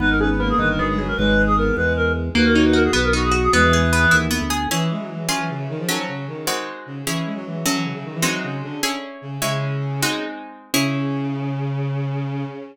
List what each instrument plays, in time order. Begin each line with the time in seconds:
0.00 drawbar organ G#1, acoustic guitar (steel) B3, violin D#4, clarinet B4
0.10 clarinet A#4
0.19 violin C#4, acoustic guitar (steel) G#4, clarinet B4
0.29 violin B3, clarinet B4
0.39 violin A#3, acoustic guitar (steel) B3, clarinet A#4
0.49 clarinet G#4
0.58 drawbar organ G1, violin D#3, acoustic guitar (steel) D#4, clarinet B4
0.69 clarinet A#4
0.78 violin F#3, acoustic guitar (steel) B3, clarinet G#4
0.88 violin G#3, clarinet G#4
0.98 violin F#3, acoustic guitar (steel) G#4, clarinet G#4
1.08 clarinet A#4
1.17 drawbar organ G#1, violin G#3, clarinet B4
1.47 clarinet G#4
1.57 violin B3, clarinet A#4
1.76 drawbar organ E2, violin G#3, clarinet B4
1.96 clarinet A#4
2.35 drawbar organ D#2, acoustic guitar (steel) A#3, violin F#4, clarinet B4
2.45 clarinet A#4
2.55 acoustic guitar (steel) D#4, clarinet C#5
2.65 clarinet B4
2.73 acoustic guitar (steel) F#4, clarinet A#4
2.84 clarinet G#4
2.93 drawbar organ B1, acoustic guitar (steel) B3, clarinet B4
3.04 clarinet A#4
3.13 acoustic guitar (steel) D#4, violin F#4, clarinet F#4
3.23 clarinet G#4
3.31 acoustic guitar (steel) F#4, clarinet F#4
3.43 clarinet G#4
3.53 drawbar organ E2, violin G#3, acoustic guitar (steel) B3, clarinet G#4 B4
3.63 violin E3
3.73 acoustic guitar (steel) G#4
3.93 acoustic guitar (steel) B3
4.11 drawbar organ D#2, acoustic guitar (steel) E4
4.31 acoustic guitar (steel) B3
4.41 drawbar organ D2
4.50 acoustic guitar (steel) G#4
4.71 violin E3, acoustic guitar (steel) C#4 E4 G#4
4.90 violin G#3
5.00 violin F#3
5.10 violin E3
5.29 violin F#3, acoustic guitar (steel) C#4 F4 G#4
5.39 violin E3
5.49 violin C#3
5.59 violin C#3
5.69 violin D#3
5.79 violin F3
5.88 violin F#3, acoustic guitar (steel) F#3 C#4 A4
6.08 violin C#3
6.27 violin D#3
6.47 acoustic guitar (steel) G#3 C4 D#4 F#4
6.86 violin C#3
7.06 violin E3, acoustic guitar (steel) C#4 E4 G#4
7.25 violin G#3
7.35 violin F#3
7.45 violin E3
7.65 violin F#3, acoustic guitar (steel) F#3 C#4 A4
7.74 violin E3
7.84 violin C#3
7.94 violin C#3
8.04 violin D#3
8.14 violin E3
8.22 violin F#3, acoustic guitar (steel) G#3 C4 D#4 F#4
8.43 violin C#3
8.63 violin D3
8.83 acoustic guitar (steel) C#4 E4 G#4
9.22 violin C#3
9.41 violin C#3, acoustic guitar (steel) G#3 C#4 E4
10.02 acoustic guitar (steel) G#3 C4 D#4 F#4
10.73 violin C#3, acoustic guitar (steel) C#4 E4 G#4